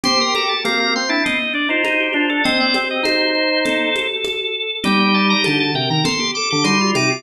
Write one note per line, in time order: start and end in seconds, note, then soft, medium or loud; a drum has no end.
0.04 0.54 G4 medium
0.04 0.19 C5 medium
0.04 0.19 C6 loud
0.04 low conga loud
0.20 0.35 A#4 medium
0.20 0.34 C6 loud
0.35 0.48 A4 medium
0.35 0.50 A#5 medium
0.35 high conga medium
0.48 0.62 A4 medium
0.48 0.63 A5 medium
0.64 0.94 A#3 medium
0.64 0.94 C4 medium
0.64 0.79 A#5 medium
0.64 high conga loud
0.80 0.94 A#5 loud
0.96 1.10 C4 medium
0.96 1.10 C6 medium
1.09 1.23 D4 medium
1.09 1.23 E4 medium
1.09 1.24 A5 medium
1.24 1.38 C4 medium
1.24 1.53 D#5 medium
1.24 low conga medium
1.53 1.68 D4 medium
1.53 1.69 D5 medium
1.69 1.83 D#4 medium
1.69 1.84 F4 medium
1.69 1.84 C5 medium
1.84 2.08 D#4 medium
1.84 2.00 D#4 medium
1.84 2.13 C5 medium
1.84 high conga medium
2.00 2.15 G4 medium
2.13 2.41 D4 medium
2.13 2.27 F4 medium
2.13 2.30 C5 medium
2.29 2.44 A4 medium
2.44 2.74 C4 medium
2.44 2.89 C5 medium
2.44 2.58 D#5 medium
2.44 low conga loud
2.60 2.74 D5 medium
2.74 3.02 C4 medium
2.74 high conga medium
2.91 3.05 D#5 medium
3.03 3.90 D#4 medium
3.03 3.28 C5 medium
3.03 4.07 C5 medium
3.03 high conga loud
3.35 3.59 C5 medium
3.65 4.75 A4 medium
3.65 low conga medium
3.96 high conga medium
4.25 high conga medium
4.83 5.34 G3 medium
4.83 5.63 D#4 medium
4.83 5.63 G4 medium
4.83 5.00 G5 medium
4.83 low conga loud
5.00 5.14 G5 medium
5.14 5.29 A5 medium
5.30 5.44 A#5 loud
5.44 5.72 D3 medium
5.44 5.59 A5 medium
5.44 high conga medium
5.60 5.74 A5 medium
5.75 5.89 C3 medium
5.75 6.00 A#4 medium
5.75 5.89 G5 medium
5.90 6.04 D#3 medium
5.90 6.05 A#5 medium
6.04 6.18 A4 loud
6.04 6.31 C6 medium
6.04 low conga loud
6.20 6.34 G4 medium
6.35 6.51 A4 medium
6.35 6.49 D6 medium
6.50 6.67 D3 medium
6.50 6.65 G4 medium
6.50 6.65 D6 medium
6.64 6.92 G3 medium
6.64 6.78 D#4 medium
6.64 6.91 C6 medium
6.64 high conga medium
6.81 6.95 F4 medium
6.95 7.23 C3 medium
6.95 7.11 D#4 medium
6.95 7.09 D6 medium
6.95 high conga medium
7.10 7.23 F4 medium
7.10 7.23 D6 medium